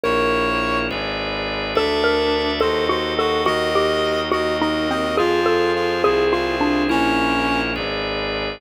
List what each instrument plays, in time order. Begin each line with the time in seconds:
0.03 violin A#1, drawbar organ E4 A#4 C#5, xylophone A#4, clarinet C#5
0.90 violin G#1, drawbar organ G#4 B4 D5
1.75 violin D2, clarinet D4, drawbar organ A4 D5 E5, xylophone A4
2.04 xylophone A#4
2.60 violin D#2, drawbar organ F#4 A4 D#5, xylophone A4, clarinet C5
2.89 xylophone F#4, clarinet C5
3.18 clarinet F#4, xylophone A4
3.45 violin D#2, drawbar organ F#4 A#4 D#5, xylophone F#4, clarinet D#5
3.75 xylophone G4
4.31 violin D#2, xylophone F#4, drawbar organ F#4 A#4 D#5, clarinet D#5
4.61 xylophone D#4, clarinet D#5
4.90 xylophone C4, clarinet D#5
5.17 violin F2, drawbar organ F4 G#4 C5, clarinet F4, xylophone G#4
5.46 xylophone A4
5.76 clarinet F4
6.04 violin C2, drawbar organ E4 G#4 C5, xylophone G#4
6.33 clarinet F4, xylophone F4
6.61 xylophone D4
6.89 violin A#1, clarinet C#4, drawbar organ E4 A#4 C#5, xylophone E4
7.75 violin G#1, drawbar organ G#4 B4 D5